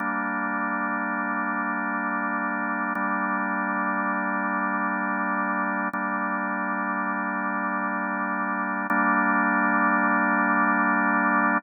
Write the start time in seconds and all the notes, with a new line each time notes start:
0.00 G3 A#3 D4
2.95 G3 A#3 D4
5.93 G3 A#3 D4
8.90 G3 A#3 D4